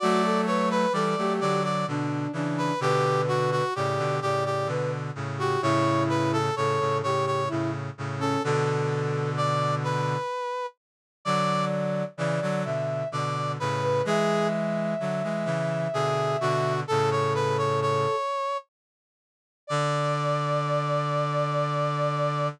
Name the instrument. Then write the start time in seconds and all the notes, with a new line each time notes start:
brass section
0.00 F#3 A3 F#4 D5
0.24 A4
0.47 B4 C#5
0.71 B4
0.93 E3 G3 A4 D5
1.18 F#3 A3 G4
1.41 D3 F#3 D5
1.64 D5
1.87 B2 D3 D4
2.33 C#3 E3 D4
2.58 B4
2.80 B2 D3 G4 B4
3.28 F#4
3.52 F#4
3.75 A2 C#3 G4 D5
3.98 B2 D3
4.22 A2 C#3 G4 D5
4.46 G4
4.67 B2 D3 B4
5.15 A2 C#3
5.38 F#4 G4
5.62 A2 C#3 E4 C#5
6.09 B4
6.33 A4
6.56 A2 C#3 A4 C#5
6.80 A2 C#3
7.03 A2 C#3 G4 C#5
7.26 C#5
7.48 A2 C#3 E4
7.98 A2 C#3
8.19 C#4 A4
8.44 B2 D3 A4
9.37 D5
9.84 B4
11.25 D3 F#3 D5
12.17 C#3 E3 D5
12.42 D3 F#3
12.65 B2 D3 E5
13.12 B2 D3 D5
13.60 A2 C#3 B4
13.82 B4
14.05 E3 G#3 G#4 E5
15.00 D3 F#3
15.23 E3 G#3
15.45 C#3 E3
15.93 B2 D3 G#4
16.41 B2 D3 F#4
16.88 A2 C#3 A4
17.11 C#5
17.35 B4
17.58 C#5
17.82 C#5
19.67 D3 D5